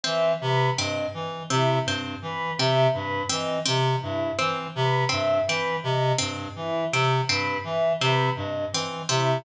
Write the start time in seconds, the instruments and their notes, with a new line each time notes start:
0.03 clarinet E3, pizzicato strings C4, choir aahs E5
0.41 clarinet C3, choir aahs B4
0.77 clarinet G2, pizzicato strings C4, choir aahs D#5
1.14 clarinet E3
1.50 clarinet C3, pizzicato strings C4, choir aahs E4
1.86 clarinet G2, pizzicato strings C4
2.22 clarinet E3, choir aahs B4
2.58 clarinet C3, pizzicato strings C4, choir aahs E5
2.93 clarinet G2, choir aahs B4
3.29 clarinet E3, pizzicato strings C4, choir aahs D#5
3.66 clarinet C3, pizzicato strings C4
4.01 clarinet G2, choir aahs E4
4.39 clarinet E3, pizzicato strings C4
4.75 clarinet C3, choir aahs B4
5.09 clarinet G2, pizzicato strings C4, choir aahs E5
5.47 clarinet E3, pizzicato strings C4, choir aahs B4
5.83 clarinet C3, choir aahs D#5
6.18 clarinet G2, pizzicato strings C4
6.56 clarinet E3, choir aahs E4
6.92 clarinet C3, pizzicato strings C4
7.28 clarinet G2, pizzicato strings C4, choir aahs B4
7.64 clarinet E3, choir aahs E5
8.00 clarinet C3, pizzicato strings C4, choir aahs B4
8.36 clarinet G2, choir aahs D#5
8.73 clarinet E3, pizzicato strings C4
9.09 clarinet C3, pizzicato strings C4, choir aahs E4